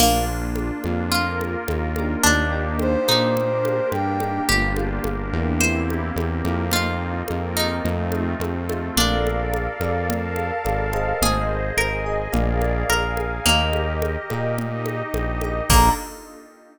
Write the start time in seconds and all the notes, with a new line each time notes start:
0.00 A#1 A#3 D4 F4, crash, low conga
0.56 high conga
0.84 F2 A#3 D4 F4, high conga
1.11 A#3 F4 A#4, low conga
1.41 high conga
1.68 D#2, high conga
1.96 A#3 D4 D#4 G4, high conga
2.23 D#2 A#3 D4 D#4 G4, low conga
2.52 A#3 D4 D#4 G4
2.79 C5, high conga
3.08 A#2 D#4, high conga
3.35 A#3 D4 G4 A#4, low conga
3.65 high conga
3.92 G2 G5, high conga
4.20 A#3 D4 D#4 G4, high conga
4.49 G1 A#3 D4 F4 G4, low conga
4.76 A#3 D4 F4 G4, high conga
5.04 G1 A#3 D4 G4 A#4, high conga
5.33 E2 A#3 D4 F4 G4
5.60 A#3 C4 E4 G4 C5, low conga
5.90 high conga
6.16 E2 A#3 C4 G4 A#4, high conga
6.44 F2 A#3 C4 E4 G4, high conga
6.71 A#3 C4 D#4 F4, low conga
7.28 F2 A#3 C4 D#4 F4 A#4, high conga
7.57 D#4, high conga
7.84 F2 A3 C4 D#4 F4, low conga
8.12 high conga
8.40 F2 A3 C4 F4 A4, high conga
8.69 A3 C4 D#4 F4, high conga
8.97 A#1 D4 A4 A#4 D5 F5, low conga
9.27 high conga
9.54 high conga
9.80 F2 A4 A#4 D5 F5, high conga
10.08 A4 A#4 F5 A5, low conga
10.36 high conga
10.64 G#1 A4 A#4 D5 F5, high conga
10.93 G#4 C5 D#5, high conga
11.21 G#1 G#4 C5 D#5, low conga
11.77 G#1 G#4 A#4 D#5 G#5, high conga
12.06 G#4 C5 D#5
12.32 A#1 G#4 A#4 D5 F5, low conga
12.62 high conga
12.89 A#1 G#4 A#4 F5 G#5, high conga
13.17 high conga
13.45 D#2 A#3 G4 A#4 D#5, low conga
13.73 high conga
14.02 high conga
14.30 A#2 G4 A#4 D#5, high conga
14.58 D#4 G4 D#5, low conga
14.86 high conga
15.14 A#1, high conga
15.41 G4 A#4 D#5, high conga
15.69 A#1 A#3 D4 F4 A4 A#5, kick, crash